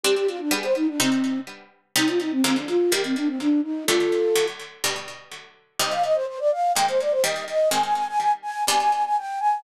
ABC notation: X:1
M:4/4
L:1/16
Q:1/4=125
K:Cm
V:1 name="Flute"
G G F D A c E D C4 z4 | E F E C C D F2 G C D C D2 E2 | [F=A]6 z10 | e f e c c d f2 g c d c e2 e2 |
a a a a a z a2 a a a a g2 a2 |]
V:2 name="Harpsichord"
[G,CD]4 [G,=B,D]4 [C,G,E]8 | [C,G,E]4 [D,F,A,B,]4 [E,G,B,]8 | [D,G,=A,]4 [D,^F,A,]4 [=B,,G,D]8 | [C,G,E]8 [E,A,B,]4 [E,G,B,]4 |
[E,A,C]8 [=B,,G,D]8 |]